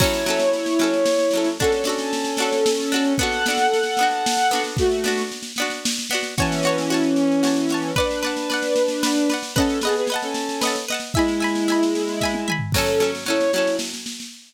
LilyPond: <<
  \new Staff \with { instrumentName = "Violin" } { \time 3/4 \key fis \minor \tempo 4 = 113 <e' cis''>2. | <cis' a'>2. | <a' fis''>2. | <a fis'>4 r2 |
<e cis'>2. | <d' b'>2. | <cis' a'>8 <b gis'>16 <b gis'>16 r16 <cis' a'>4~ <cis' a'>16 r8 | <gis e'>2. |
<cis' a'>8. r16 <e' cis''>8 <e' cis''>8 r4 | }
  \new Staff \with { instrumentName = "Pizzicato Strings" } { \time 3/4 \key fis \minor <fis cis' a'>8 <fis cis' a'>4 <fis cis' a'>4 <fis cis' a'>8 | <d' fis' a'>8 <d' fis' a'>4 <d' fis' a'>4 <d' fis' a'>8 | <b d' fis'>8 <b d' fis'>4 <b d' fis'>4 <b d' fis'>8~ | <b d' fis'>8 <b d' fis'>4 <b d' fis'>4 <b d' fis'>8 |
<fis' cis'' a''>8 <fis' cis'' a''>8 <fis' cis'' a''>4 <fis' cis'' a''>8 <fis' cis'' a''>8 | <b' d'' fis''>8 <b' d'' fis''>8 <b' d'' fis''>4 <b' d'' fis''>8 <b' d'' fis''>8 | <b' dis'' fis'' a''>8 <b' dis'' fis'' a''>8 <b' dis'' fis'' a''>4 <b' dis'' fis'' a''>8 <b' dis'' fis'' a''>8 | <e'' gis'' b''>8 <e'' gis'' b''>8 <e'' gis'' b''>4 <e'' gis'' b''>8 <e'' gis'' b''>8 |
<fis cis' a'>8 <fis cis' a'>8 <fis cis' a'>8 <fis cis' a'>4. | }
  \new DrumStaff \with { instrumentName = "Drums" } \drummode { \time 3/4 <cymc bd sn>16 sn16 sn16 sn16 sn16 sn16 sn16 sn16 sn16 sn16 sn16 sn16 | <bd sn>16 sn16 sn16 sn16 sn16 sn16 sn16 sn16 sn16 sn16 sn16 sn16 | <bd sn>16 sn16 sn16 sn16 sn16 sn16 sn16 sn16 sn16 sn16 sn16 sn16 | <bd sn>16 sn16 sn16 sn16 sn16 sn16 sn16 sn16 sn16 sn16 sn16 sn16 |
<bd sn>16 sn16 sn16 sn16 sn16 sn16 sn16 sn16 sn16 sn16 sn16 sn16 | <bd sn>16 sn16 sn16 sn16 sn16 sn16 sn16 sn16 sn16 sn16 sn16 sn16 | <bd sn>16 sn16 sn16 sn16 sn16 sn16 sn16 sn16 sn16 sn16 sn16 sn16 | <bd sn>16 sn16 sn16 sn16 sn16 sn16 sn16 sn16 <bd sn>16 tommh16 toml16 tomfh16 |
<cymc bd sn>16 sn16 sn16 sn16 sn16 sn16 sn16 sn16 sn16 sn16 sn16 sn16 | }
>>